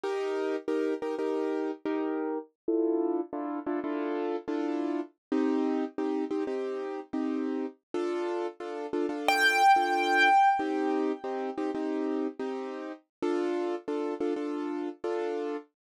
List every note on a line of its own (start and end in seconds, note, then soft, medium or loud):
0.03 0.56 D#4 loud
0.03 0.56 G4 loud
0.03 0.56 A#4 loud
0.68 0.94 D#4 medium
0.68 0.94 G4 loud
0.68 0.94 A#4 loud
1.02 1.15 D#4 medium
1.02 1.15 G4 medium
1.02 1.15 A#4 loud
1.18 1.71 D#4 medium
1.18 1.71 G4 medium
1.18 1.71 A#4 medium
1.85 2.38 D#4 loud
1.85 2.38 G4 medium
1.85 2.38 A#4 loud
2.68 3.21 D4 loud
2.68 3.21 E4 loud
2.68 3.21 F4 loud
2.68 3.21 A4 loud
3.33 3.59 D4 loud
3.33 3.59 E4 loud
3.33 3.59 F4 loud
3.33 3.59 A4 medium
3.66 3.80 D4 loud
3.66 3.80 E4 loud
3.66 3.80 F4 medium
3.66 3.80 A4 medium
3.84 4.36 D4 medium
3.84 4.36 E4 medium
3.84 4.36 F4 loud
3.84 4.36 A4 loud
4.48 5.00 D4 loud
4.48 5.00 E4 medium
4.48 5.00 F4 loud
4.48 5.00 A4 medium
5.32 5.84 C4 loud
5.32 5.84 D#4 loud
5.32 5.84 G4 loud
5.98 6.24 C4 loud
5.98 6.24 D#4 loud
5.98 6.24 G4 medium
6.30 6.44 C4 loud
6.30 6.44 D#4 medium
6.30 6.44 G4 loud
6.47 7.00 C4 medium
6.47 7.00 D#4 medium
6.47 7.00 G4 loud
7.13 7.66 C4 medium
7.13 7.66 D#4 medium
7.13 7.66 G4 medium
7.94 8.47 D4 loud
7.94 8.47 F4 loud
7.94 8.47 A4 loud
8.60 8.86 D4 medium
8.60 8.86 F4 medium
8.60 8.86 A4 medium
8.93 9.06 D4 loud
8.93 9.06 F4 loud
8.93 9.06 A4 medium
9.09 9.62 D4 loud
9.09 9.62 F4 medium
9.09 9.62 A4 loud
9.28 10.48 G5 medium
9.76 10.29 D4 medium
9.76 10.29 F4 loud
9.76 10.29 A4 loud
10.59 11.12 C4 loud
10.59 11.12 D#4 loud
10.59 11.12 G4 loud
11.24 11.50 C4 loud
11.24 11.50 D#4 medium
11.24 11.50 G4 medium
11.57 11.71 C4 loud
11.57 11.71 D#4 loud
11.57 11.71 G4 loud
11.75 12.27 C4 medium
11.75 12.27 D#4 loud
11.75 12.27 G4 medium
12.39 12.92 C4 loud
12.39 12.92 D#4 loud
12.39 12.92 G4 medium
13.22 13.75 D4 loud
13.22 13.75 F4 loud
13.22 13.75 A4 loud
13.88 14.14 D4 medium
13.88 14.14 F4 medium
13.88 14.14 A4 loud
14.20 14.34 D4 medium
14.20 14.34 F4 medium
14.20 14.34 A4 medium
14.36 14.89 D4 medium
14.36 14.89 F4 medium
14.36 14.89 A4 medium
15.04 15.57 D4 loud
15.04 15.57 F4 loud
15.04 15.57 A4 medium